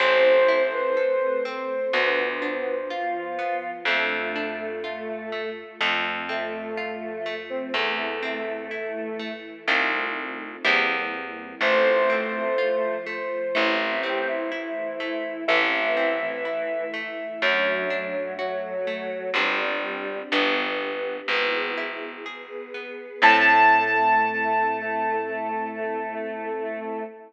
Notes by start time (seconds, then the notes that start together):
0.00 A1 C4 E4 A4 C5
0.48 E4
0.73 B4
0.96 A3 C4 A4
1.45 C4
1.93 D2 B3 D4 F4
2.42 D4
2.90 F3 B3 F4
3.39 B3
3.85 F2 A3 D4 F4
4.35 D4
4.84 A3 F4 A4
5.32 A3
5.81 F2 A3 C4 F4
6.29 A3 C4
6.77 F3 A3 F4
7.26 A3
7.50 C4
7.74 E2 A3 C4 E4
8.23 C4
8.71 E3 A3 E4
9.19 A3
9.68 C2 A3 C4 D#4 F4
10.65 E2 G3 A#3 C4 E4
11.61 A1 A3 C4 F4 C5
12.10 C4
12.58 F3 A3 F4
13.06 A3
13.55 A1 A3 C4 E4
14.03 C4 G4
14.27 E4
14.52 E3 A3 E4
15.00 A3
15.48 A1 E3 A3 C4 E4 E5
15.97 C4
16.21 E3
16.45 E3 A3 E4
16.94 A3
17.42 F#2 F#3 A3 D4 F#4
17.90 D4
18.39 F#3 A3 F#4 A4
18.87 A3
19.34 G1 G3 C4 D4 G4
20.32 G1 B3 D4 G4
21.28 G#1 B3 E4 G#4
21.77 E4
22.26 B3 G#4 B4
22.74 B3
23.22 A2 A3 C4 E4 A4 A5